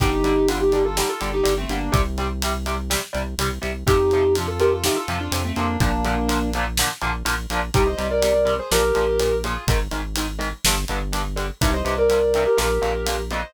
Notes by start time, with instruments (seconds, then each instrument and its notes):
0.00 synth bass 1 G1, overdriven guitar D3 G3, distortion guitar D#4 G4, kick, closed hi-hat
0.24 overdriven guitar D3 G3, closed hi-hat
0.48 overdriven guitar D3 G3, distortion guitar D4 F4, closed hi-hat
0.60 distortion guitar D#4 G4
0.72 overdriven guitar D3 G3, distortion guitar D#4 G4, closed hi-hat
0.85 distortion guitar F4 A4
0.97 overdriven guitar D3 G3, distortion guitar D#4 G4, snare
1.09 distortion guitar F4 A4
1.21 synth bass 1 G1, overdriven guitar D3 G3, closed hi-hat
1.33 distortion guitar D#4 G4
1.44 synth bass 1 G1, overdriven guitar D3 G3, closed hi-hat
1.57 distortion guitar A3 C4
1.69 synth bass 1 G1, overdriven guitar D3 G3, distortion guitar A#3 D4, closed hi-hat
1.92 synth bass 1 C2, overdriven guitar C3 G3, kick, closed hi-hat
2.18 overdriven guitar C3 G3, closed hi-hat
2.42 overdriven guitar C3 G3, closed hi-hat
2.66 overdriven guitar C3 G3, closed hi-hat
2.90 overdriven guitar C3 G3, snare
3.13 synth bass 1 C2, overdriven guitar C3 G3, closed hi-hat
3.38 synth bass 1 C2, overdriven guitar C3 G3, closed hi-hat
3.62 synth bass 1 C2, overdriven guitar C3 G3, closed hi-hat
3.86 synth bass 1 F2, overdriven guitar C3 F3, distortion guitar D#4 G4, kick, closed hi-hat
4.11 overdriven guitar C3 F3, closed hi-hat
4.35 overdriven guitar C3 F3, distortion guitar D4 F4, closed hi-hat
4.48 distortion guitar F4 A4
4.60 overdriven guitar C3 F3, distortion guitar G4 A#4, closed hi-hat
4.72 distortion guitar F4 A4
4.84 overdriven guitar C3 F3, distortion guitar D#4 G4, snare
4.96 distortion guitar F4 A4
5.08 synth bass 1 F2, overdriven guitar C3 F3, closed hi-hat
5.20 distortion guitar D4 F4
5.32 synth bass 1 F2, overdriven guitar C3 F3, closed hi-hat
5.44 distortion guitar A3 C4
5.56 synth bass 1 F2, overdriven guitar C3 F3, distortion guitar A#3 D4, closed hi-hat
5.80 synth bass 1 A#1, overdriven guitar A#2 D3 F3, distortion guitar A#3 D4, kick, closed hi-hat
6.05 overdriven guitar A#2 D3 F3, closed hi-hat
6.29 overdriven guitar A#2 D3 F3, closed hi-hat
6.53 overdriven guitar A#2 D3 F3, closed hi-hat
6.77 overdriven guitar A#2 D3 F3, snare
7.01 synth bass 1 A#1, overdriven guitar A#2 D3 F3, closed hi-hat
7.25 synth bass 1 A#1, overdriven guitar A#2 D3 F3, closed hi-hat
7.50 synth bass 1 A#1, overdriven guitar A#2 D3 F3, closed hi-hat
7.74 synth bass 1 C2, overdriven guitar C3 G3, distortion guitar D#4 G4, kick, closed hi-hat
7.86 distortion guitar C5 D#5
7.98 synth bass 1 C2, overdriven guitar C3 G3, closed hi-hat
8.10 distortion guitar A#4 D5
8.22 overdriven guitar C3 G3, closed hi-hat
8.45 overdriven guitar C3 G3, closed hi-hat
8.59 distortion guitar G#4 C5
8.71 synth bass 1 A#1, overdriven guitar A#2 F3, distortion guitar G4 A#4, snare
8.95 synth bass 1 A#1, overdriven guitar A#2 F3, closed hi-hat
9.19 overdriven guitar A#2 F3, closed hi-hat
9.44 overdriven guitar A#2 F3, distortion guitar F4 G#4, closed hi-hat
9.67 synth bass 1 G#1, overdriven guitar G#2 D#3, kick, closed hi-hat
9.91 synth bass 1 G#1, overdriven guitar G#2 D#3, closed hi-hat
10.16 overdriven guitar G#2 D#3, closed hi-hat
10.39 overdriven guitar G#2 D#3, closed hi-hat
10.64 synth bass 1 G1, overdriven guitar G2 D3, snare
10.88 synth bass 1 G1, overdriven guitar G2 D3, closed hi-hat
11.13 overdriven guitar G2 D3, closed hi-hat
11.36 overdriven guitar G2 D3, closed hi-hat
11.61 synth bass 1 C2, overdriven guitar G2 C3, distortion guitar D#4 G4, kick, closed hi-hat
11.73 distortion guitar C5 D#5
11.85 synth bass 1 C2, overdriven guitar G2 C3, closed hi-hat
11.98 distortion guitar A#4 D5
12.09 overdriven guitar G2 C3, closed hi-hat
12.34 overdriven guitar G2 C3, closed hi-hat
12.46 distortion guitar G4 A#4
12.57 synth bass 1 A#1, overdriven guitar F2 A#2, distortion guitar G4 A#4, snare
12.82 synth bass 1 A#1, overdriven guitar F2 A#2, closed hi-hat
13.06 overdriven guitar F2 A#2, closed hi-hat
13.31 overdriven guitar F2 A#2, distortion guitar C5 D#5, closed hi-hat